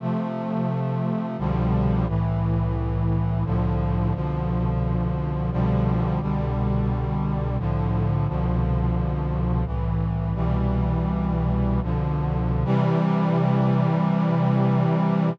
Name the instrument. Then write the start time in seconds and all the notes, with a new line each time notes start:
brass section
0.00 C3 F3 A3
1.38 C2 B2 D3 F3 G3
2.07 C2 A2 E3
3.45 C2 A2 D3 F3
4.14 C2 B2 D3 F3
5.51 C2 B2 D3 F3 G3
6.21 C2 B2 D3 G3
7.58 C2 A2 D3 F3
8.27 C2 B2 D3 F3
9.66 C2 A2 E3
10.34 C2 B2 E3 G3
11.82 C2 B2 D3 F3
12.65 C3 E3 G3